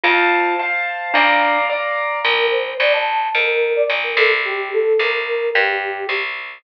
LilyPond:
<<
  \new Staff \with { instrumentName = "Glockenspiel" } { \time 2/4 \key bes \major \tempo 4 = 109 f'4 r4 | d'4 r4 | r2 | r2 |
r2 | r2 | }
  \new Staff \with { instrumentName = "Flute" } { \time 2/4 \key bes \major r2 | r2 | bes'8 c''8 d''16 a''8. | bes'8. d''16 r16 bes'16 a'16 r16 |
g'8 a'8 bes'16 bes'8. | g'4 r4 | }
  \new Staff \with { instrumentName = "Acoustic Grand Piano" } { \time 2/4 \key bes \major <c'' f'' a''>4 <c'' f'' a''>4 | <d'' f'' bes''>4 <d'' f'' bes''>4 | r2 | r2 |
r2 | r2 | }
  \new Staff \with { instrumentName = "Electric Bass (finger)" } { \clef bass \time 2/4 \key bes \major f,2 | bes,,2 | bes,,4 bes,,4 | f,4 bes,,8 c,8~ |
c,4 c,4 | g,4 c,4 | }
>>